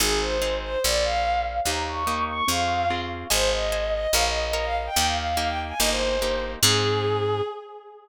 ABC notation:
X:1
M:2/4
L:1/16
Q:1/4=145
K:Ab
V:1 name="Violin"
A2 c4 c2 | =d2 f4 f2 | b2 d'4 d'2 | f4 z4 |
c2 e4 e2 | f e e e e f z g | g f f f f g z a | e c5 z2 |
A8 |]
V:2 name="Orchestral Harp"
[CEA]4 [CEA]4 | z8 | [B,EG]4 [B,EG]4 | [CFA]4 [CFA]4 |
[cea]4 [cea]4 | [Bdf]4 [Bdf]4 | [B,EG]4 [B,EG]4 | [B,EG]4 [B,EG]4 |
[CEA]8 |]
V:3 name="Electric Bass (finger)" clef=bass
A,,,8 | B,,,8 | E,,8 | F,,8 |
A,,,8 | B,,,8 | E,,8 | G,,,8 |
A,,8 |]